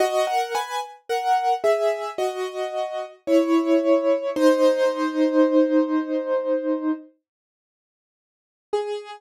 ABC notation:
X:1
M:4/4
L:1/16
Q:1/4=55
K:G#m
V:1 name="Acoustic Grand Piano"
[Fd] [Af] [Bg] z [Af]2 [Ge]2 [Fd]4 [Ec]4 | [D^B]10 z6 | G4 z12 |]